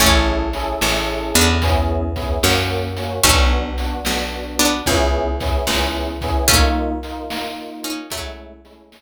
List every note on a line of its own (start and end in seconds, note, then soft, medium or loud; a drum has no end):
0.00 0.75 A1 medium
0.00 1.10 A3 medium
0.00 0.44 C#4 loud
0.00 1.10 C#4 medium
0.00 0.44 E4 loud
0.00 0.44 G#4 loud
0.00 0.44 A4 loud
0.00 kick loud
0.00 closed hi-hat medium
0.53 0.76 C#4 loud
0.53 0.76 E4 medium
0.53 0.76 G#4 loud
0.53 0.76 A4 loud
0.53 closed hi-hat medium
0.81 1.33 A1 medium
0.81 1.51 C#4 loud
0.81 1.51 E4 loud
0.81 1.51 G#4 medium
0.81 1.51 A4 loud
0.81 snare loud
1.34 2.39 E2 medium
1.34 1.57 B3 medium
1.34 1.57 D4 medium
1.34 closed hi-hat medium
1.62 2.05 B3 loud
1.62 2.05 C#4 loud
1.62 2.05 E4 loud
1.62 2.05 G#4 loud
1.62 kick medium
1.62 closed hi-hat loud
2.16 2.37 B3 loud
2.16 2.37 C#4 loud
2.16 2.37 E4 medium
2.16 2.37 G#4 medium
2.16 kick medium
2.16 closed hi-hat medium
2.43 3.20 F#2 medium
2.43 2.86 A#3 loud
2.43 2.86 C#4 loud
2.43 2.86 F#4 loud
2.43 snare loud
2.97 3.19 A#3 medium
2.97 3.19 C#4 loud
2.97 3.19 F#4 medium
2.97 closed hi-hat medium
3.23 4.00 B1 medium
3.23 4.30 A3 medium
3.23 3.68 B3 loud
3.23 4.30 C#4 loud
3.23 3.68 D4 loud
3.23 3.68 F#4 loud
3.23 kick loud
3.23 closed hi-hat loud
3.78 4.00 B3 medium
3.78 4.00 D4 medium
3.78 4.00 F#4 loud
3.78 closed hi-hat medium
4.05 4.82 B1 medium
4.05 4.75 B3 medium
4.05 4.75 D4 loud
4.05 4.75 F#4 medium
4.05 snare loud
4.59 4.82 B3 medium
4.59 4.82 D4 medium
4.59 closed hi-hat medium
4.86 5.63 C#2 medium
4.86 5.30 B3 loud
4.86 5.30 C#4 loud
4.86 5.30 E4 loud
4.86 5.30 G#4 loud
4.86 kick medium
4.86 closed hi-hat medium
5.40 5.62 B3 loud
5.40 5.62 C#4 loud
5.40 5.62 E4 loud
5.40 5.62 G#4 medium
5.40 kick medium
5.40 snare soft
5.40 closed hi-hat medium
5.67 6.43 C#2 medium
5.67 6.11 B3 medium
5.67 6.11 C#4 loud
5.67 6.11 E4 medium
5.67 6.11 G#4 medium
5.67 snare loud
6.21 6.44 B3 loud
6.21 6.44 C#4 loud
6.21 6.44 E4 loud
6.21 6.44 G#4 loud
6.21 kick medium
6.21 closed hi-hat medium
6.48 7.55 A3 medium
6.48 6.92 A#3 loud
6.48 7.55 C#4 medium
6.48 6.92 D#4 loud
6.48 6.92 F4 loud
6.48 kick loud
6.48 closed hi-hat medium
7.03 7.25 A#3 medium
7.03 7.25 D#4 loud
7.03 7.25 F4 medium
7.03 closed hi-hat medium
7.30 8.00 A#3 medium
7.30 8.00 D#4 loud
7.30 8.00 F4 loud
7.30 snare loud
7.83 8.07 C#4 medium
7.83 8.07 D#4 medium
7.83 closed hi-hat medium
8.10 8.87 F#3 medium
8.10 8.54 G#3 loud
8.10 8.54 A3 loud
8.10 8.87 A3 medium
8.10 8.54 C#4 loud
8.10 8.54 E4 loud
8.10 kick medium
8.10 closed hi-hat loud
8.64 8.86 G#3 loud
8.64 8.86 A3 loud
8.64 8.86 C#4 loud
8.64 8.86 E4 loud
8.64 snare soft
8.64 closed hi-hat medium
8.92 9.02 G#3 loud
8.92 9.02 A3 medium
8.92 9.02 C#4 loud
8.92 9.02 E4 medium
8.92 snare loud